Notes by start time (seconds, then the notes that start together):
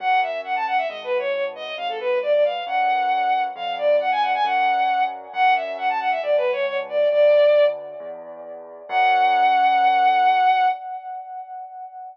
0.00 F#2 F#5
0.22 E5
0.44 F#5
0.56 A5
0.67 F#5
0.78 E5
0.89 G#1 D#5
1.04 B4
1.18 C#5
1.34 C#5
1.55 D#5
1.77 G#1 F5
1.89 A4
2.00 B4
2.22 D5
2.33 D5
2.45 F5
2.67 F#2 F#5
3.55 F2 F5
3.78 D5
4.00 F#5
4.11 G#5
4.22 F#5
4.34 G#5
4.44 F#2 F#5
5.33 F#2 F#5
5.55 E5
5.78 F#5
5.89 A5
6.00 F#5
6.11 E5
6.22 C#2 D5
6.37 B4
6.52 C#5
6.67 C#5
6.89 D5
7.11 D2 D5
8.00 E2
8.89 F#2 F#5